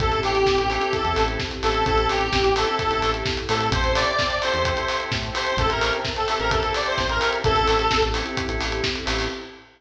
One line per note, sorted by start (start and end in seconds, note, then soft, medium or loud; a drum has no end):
0.00 0.21 A1 medium
0.00 0.37 C4 loud
0.00 1.84 C4 medium
0.00 0.37 E4 medium
0.00 1.84 E4 medium
0.00 0.37 G4 loud
0.00 1.84 G4 medium
0.00 0.20 A4 medium
0.00 0.37 A4 loud
0.00 1.84 A4 medium
0.00 kick loud
0.00 closed hi-hat medium
0.12 closed hi-hat medium
0.23 0.44 A1 medium
0.23 0.68 G4 medium
0.23 open hi-hat medium
0.35 closed hi-hat medium
0.46 0.56 A1 medium
0.46 kick medium
0.46 snare loud
0.57 0.78 A1 medium
0.57 closed hi-hat medium
0.70 0.79 C4 medium
0.70 0.79 E4 medium
0.70 0.91 G4 medium
0.70 0.79 G4 medium
0.70 0.79 A4 medium
0.70 open hi-hat medium
0.79 0.98 C4 loud
0.79 0.98 E4 medium
0.79 0.98 G4 loud
0.79 0.98 A4 medium
0.79 closed hi-hat medium
0.93 1.23 A4 medium
0.93 kick medium
0.93 closed hi-hat medium
1.04 1.16 E2 medium
1.04 1.41 C4 medium
1.04 1.41 E4 medium
1.04 1.41 G4 medium
1.04 1.41 A4 medium
1.04 closed hi-hat medium
1.16 1.37 A1 medium
1.16 open hi-hat medium
1.28 closed hi-hat medium
1.39 kick medium
1.39 snare loud
1.51 closed hi-hat medium
1.63 1.84 A1 medium
1.63 1.82 C4 medium
1.63 1.82 E4 medium
1.63 1.82 G4 medium
1.63 1.85 A4 medium
1.63 1.82 A4 medium
1.63 open hi-hat medium
1.74 closed hi-hat medium
1.85 2.07 A1 medium
1.85 2.22 C4 loud
1.85 3.71 C4 medium
1.85 2.22 E4 loud
1.85 3.71 E4 medium
1.85 2.22 G4 loud
1.85 3.71 G4 medium
1.85 2.22 A4 loud
1.85 2.07 A4 medium
1.85 3.71 A4 medium
1.85 kick medium
1.85 closed hi-hat medium
1.98 closed hi-hat medium
2.09 2.30 A1 medium
2.09 2.53 G4 medium
2.09 open hi-hat medium
2.21 closed hi-hat medium
2.32 2.43 A1 medium
2.32 kick medium
2.32 snare loud
2.44 2.65 A1 medium
2.44 closed hi-hat medium
2.56 2.65 C4 medium
2.56 2.65 E4 medium
2.56 2.65 G4 medium
2.56 2.65 A4 medium
2.56 2.76 A4 medium
2.56 open hi-hat medium
2.67 2.86 C4 medium
2.67 2.86 E4 medium
2.67 2.86 G4 loud
2.67 2.86 A4 medium
2.67 closed hi-hat medium
2.79 3.10 A4 medium
2.79 kick medium
2.79 closed hi-hat medium
2.90 3.02 A1 medium
2.90 3.28 C4 medium
2.90 3.28 E4 medium
2.90 3.28 G4 medium
2.90 3.28 A4 medium
2.90 closed hi-hat medium
3.02 3.23 A1 medium
3.02 open hi-hat medium
3.14 closed hi-hat medium
3.26 kick medium
3.26 snare loud
3.37 closed hi-hat medium
3.49 3.70 A2 medium
3.49 3.67 C4 medium
3.49 3.67 E4 medium
3.49 3.67 G4 medium
3.49 3.67 A4 medium
3.49 3.68 A4 medium
3.49 open hi-hat medium
3.60 closed hi-hat medium
3.71 3.82 A1 medium
3.71 4.09 C4 loud
3.71 4.09 E4 loud
3.71 4.09 G4 loud
3.71 4.09 A4 loud
3.71 5.56 C5 medium
3.71 3.92 C5 medium
3.71 5.56 E5 medium
3.71 5.56 G5 medium
3.71 5.56 A5 medium
3.71 kick loud
3.71 closed hi-hat loud
3.84 4.05 A1 medium
3.84 closed hi-hat medium
3.95 4.38 D5 medium
3.95 open hi-hat medium
4.07 closed hi-hat medium
4.19 kick medium
4.19 snare loud
4.30 closed hi-hat medium
4.42 4.53 C4 loud
4.42 4.53 E4 medium
4.42 4.53 G4 medium
4.42 4.53 A4 medium
4.42 4.63 C5 medium
4.42 open hi-hat medium
4.54 4.75 E2 medium
4.54 4.73 C4 medium
4.54 4.73 E4 medium
4.54 4.73 G4 medium
4.54 4.73 A4 medium
4.54 closed hi-hat medium
4.65 4.98 C5 medium
4.65 kick medium
4.65 closed hi-hat loud
4.77 5.14 C4 medium
4.77 5.14 E4 medium
4.77 5.14 G4 medium
4.77 5.14 A4 loud
4.77 closed hi-hat medium
4.88 open hi-hat medium
5.00 closed hi-hat medium
5.11 5.32 A2 medium
5.11 kick medium
5.11 snare loud
5.23 closed hi-hat medium
5.33 5.52 C4 medium
5.33 5.52 E4 medium
5.33 5.52 G4 loud
5.33 5.52 A4 medium
5.33 5.56 C5 medium
5.33 open hi-hat medium
5.46 closed hi-hat medium
5.57 5.68 A1 medium
5.57 5.97 C4 loud
5.57 5.97 E4 loud
5.57 5.97 G4 loud
5.57 5.69 A4 medium
5.57 5.97 A4 loud
5.57 7.43 C5 medium
5.57 7.43 E5 medium
5.57 7.43 G5 medium
5.57 7.43 A5 medium
5.57 kick loud
5.57 closed hi-hat loud
5.70 5.91 A1 medium
5.70 5.91 A#4 medium
5.70 closed hi-hat medium
5.81 open hi-hat medium
5.93 closed hi-hat medium
6.05 kick medium
6.05 snare loud
6.16 6.38 A4 medium
6.16 closed hi-hat medium
6.28 6.38 C4 medium
6.28 6.38 E4 medium
6.28 6.38 G4 medium
6.28 6.38 A4 medium
6.28 open hi-hat medium
6.39 6.60 A1 medium
6.39 6.58 C4 loud
6.39 6.58 E4 medium
6.39 6.58 G4 medium
6.39 6.58 A4 medium
6.39 6.50 A#4 medium
6.39 closed hi-hat medium
6.51 6.73 A4 medium
6.51 kick loud
6.51 closed hi-hat loud
6.63 7.01 C4 medium
6.63 7.01 E4 medium
6.63 7.01 G4 medium
6.63 7.01 A4 medium
6.63 closed hi-hat medium
6.74 6.86 D5 medium
6.74 open hi-hat medium
6.86 6.97 C5 medium
6.86 closed hi-hat medium
6.98 7.19 A1 medium
6.98 7.09 C5 medium
6.98 kick medium
6.98 snare loud
7.09 7.29 A#4 medium
7.09 closed hi-hat medium
7.20 7.38 C4 medium
7.20 7.38 E4 medium
7.20 7.38 G4 medium
7.20 7.38 A4 medium
7.20 open hi-hat medium
7.33 closed hi-hat medium
7.44 7.66 A1 medium
7.44 9.29 C4 medium
7.44 7.82 C4 loud
7.44 9.29 E4 medium
7.44 7.82 E4 loud
7.44 9.29 G4 medium
7.44 7.82 G4 loud
7.44 8.04 A4 loud
7.44 9.29 A4 medium
7.44 7.82 A4 loud
7.44 kick loud
7.44 closed hi-hat loud
7.56 closed hi-hat medium
7.67 7.88 A1 medium
7.67 open hi-hat medium
7.79 closed hi-hat medium
7.91 8.02 A1 medium
7.91 kick medium
7.91 snare loud
8.02 8.23 A1 medium
8.02 closed hi-hat medium
8.14 8.24 C4 medium
8.14 8.24 E4 medium
8.14 8.24 G4 medium
8.14 8.24 A4 medium
8.14 open hi-hat medium
8.26 8.44 C4 medium
8.26 8.44 E4 medium
8.26 8.44 G4 medium
8.26 8.44 A4 medium
8.26 closed hi-hat medium
8.37 kick medium
8.37 closed hi-hat loud
8.48 8.59 A1 medium
8.48 8.85 C4 medium
8.48 8.85 E4 loud
8.48 8.85 G4 medium
8.48 8.85 A4 medium
8.48 closed hi-hat medium
8.60 8.81 A1 medium
8.60 open hi-hat medium
8.72 closed hi-hat medium
8.84 kick medium
8.84 snare loud
8.95 closed hi-hat medium
9.05 9.28 A1 medium
9.05 9.24 C4 loud
9.05 9.24 E4 medium
9.05 9.24 G4 medium
9.05 9.24 A4 medium
9.05 open hi-hat medium
9.19 open hi-hat medium